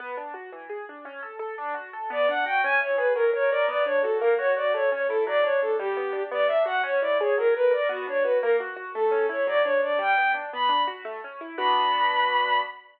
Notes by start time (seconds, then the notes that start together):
0.00 B3
0.17 D4
0.34 F#4
0.52 E3
0.69 G#4
0.89 D4
1.05 C#4
1.23 A4
1.39 A4
1.58 D4
1.74 F#4
1.93 A4
2.10 B3 D5
2.28 D4 F#5
2.46 F#4 G5
2.64 C#4 G#5
2.81 E4 C#5
2.97 G#4 B4
3.15 F#3 A#4
3.34 A#4 C#5
3.50 A#4 D5
3.68 B3 D5
3.85 D4 C#5
4.02 F#4 A4
4.19 A#3 A#4
4.38 F#4 C#5
4.56 F#4 D5
4.74 A3 C#5
4.92 C#4 C#5
5.08 E4 A4
5.27 F#3 D5
5.43 D4 C#5
5.61 D4 A4
5.78 G3 G4
5.97 B3
6.13 D4
6.31 B3 D5
6.47 D4 E5
6.65 F#4 F#5
6.83 C#4 C#5
7.01 E4 D5
7.20 G#4 C#5
7.38 F#3 A#4
7.54 A#4 B4
7.71 A#4 D5
7.89 B3 F#4
8.07 D4 C#5
8.23 F#4 B4
8.42 A#3 A#4
8.60 F#4
8.76 F#4
8.94 A3 A4
9.11 C#4
9.29 E4 C#5
9.47 F#3 D5
9.64 D4 C#5
9.82 D4 D5
9.99 G3 G5
10.18 B3
10.34 D4
10.53 B3 B5
10.69 D4
10.87 F#4
11.05 A3
11.24 C#4
11.41 E4
11.57 B3 D4 F#4 B5